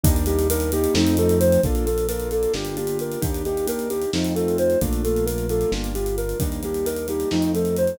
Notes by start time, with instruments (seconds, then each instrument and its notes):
0.04 synth bass 1 D#2, acoustic grand piano G3 A#3 D4 D#4, ocarina D4, kick, closed hi-hat
0.16 closed hi-hat
0.26 acoustic grand piano G3 A#3 D4 D#4, ocarina G4, closed hi-hat
0.39 closed hi-hat
0.50 acoustic grand piano G3 A#3 D4 D#4, ocarina A#4, closed hi-hat
0.60 closed hi-hat
0.72 acoustic grand piano G3 A#3 D4 D#4, ocarina G4, closed hi-hat
0.84 closed hi-hat
0.94 synth bass 1 F2, acoustic grand piano F3 A3 C4 D#4, ocarina D#4, snare
1.07 closed hi-hat
1.17 acoustic grand piano F3 A3 C4 D#4, ocarina A4, closed hi-hat
1.29 closed hi-hat
1.40 ocarina C5, closed hi-hat
1.52 closed hi-hat
1.63 synth bass 1 A#1, acoustic grand piano A#3 D4 F4 A4, ocarina D4, kick, closed hi-hat
1.75 closed hi-hat
1.86 acoustic grand piano A#3 D4 F4 A4, ocarina A4, closed hi-hat
1.98 closed hi-hat
2.08 acoustic grand piano A#3 D4 F4 A4, ocarina A#4, closed hi-hat
2.20 closed hi-hat
2.31 acoustic grand piano A#3 D4 F4 A4, ocarina A4, closed hi-hat
2.43 closed hi-hat
2.54 synth bass 1 G1, acoustic grand piano A#3 D4 F4 G4, ocarina D4, snare
2.65 closed hi-hat
2.77 acoustic grand piano A#3 D4 F4 G4, ocarina G4, closed hi-hat
2.87 closed hi-hat
2.99 ocarina A#4, closed hi-hat
3.12 closed hi-hat
3.21 synth bass 1 D#2, acoustic grand piano A#3 D4 D#4 G4, ocarina D4, kick, closed hi-hat
3.34 closed hi-hat
3.45 acoustic grand piano A#3 D4 D#4 G4, ocarina G4, closed hi-hat
3.57 closed hi-hat
3.67 acoustic grand piano A#3 D4 D#4 G4, ocarina A#4, closed hi-hat
3.79 closed hi-hat
3.89 acoustic grand piano A#3 D4 D#4 G4, ocarina G4, closed hi-hat
4.02 closed hi-hat
4.13 synth bass 1 F2, acoustic grand piano A3 C4 D#4 F4, ocarina D#4, snare
4.25 closed hi-hat
4.36 acoustic grand piano A3 C4 D#4 F4, ocarina A4, closed hi-hat
4.48 closed hi-hat
4.58 ocarina C5, closed hi-hat
4.70 closed hi-hat
4.81 synth bass 1 A#1, acoustic grand piano A3 A#3 D4 F4, ocarina D4, kick, closed hi-hat
4.93 closed hi-hat
5.04 acoustic grand piano A3 A#3 D4 F4, ocarina A4, closed hi-hat
5.16 closed hi-hat
5.26 acoustic grand piano A3 A#3 D4 F4, ocarina A#4, closed hi-hat
5.38 closed hi-hat
5.49 acoustic grand piano A3 A#3 D4 F4, ocarina A4, closed hi-hat
5.61 closed hi-hat
5.72 synth bass 1 G1, acoustic grand piano G3 A#3 D4 F4, ocarina D4, snare
5.84 closed hi-hat
5.95 acoustic grand piano G3 A#3 D4 F4, ocarina G4, closed hi-hat
6.06 closed hi-hat
6.18 ocarina A#4, closed hi-hat
6.29 closed hi-hat
6.40 synth bass 1 D#2, acoustic grand piano G3 A#3 D4 D#4, ocarina D4, kick, closed hi-hat
6.52 closed hi-hat
6.63 acoustic grand piano G3 A#3 D4 D#4, ocarina G4, closed hi-hat
6.74 closed hi-hat
6.85 acoustic grand piano G3 A#3 D4 D#4, ocarina A#4, closed hi-hat
6.96 closed hi-hat
7.08 acoustic grand piano G3 A#3 D4 D#4, ocarina G4, closed hi-hat
7.20 closed hi-hat
7.31 synth bass 1 F2, acoustic grand piano F3 A3 C4 D#4, ocarina D#4, snare
7.42 closed hi-hat
7.54 acoustic grand piano F3 A3 C4 D#4, ocarina A4, closed hi-hat
7.65 closed hi-hat
7.77 ocarina C5, closed hi-hat
7.87 closed hi-hat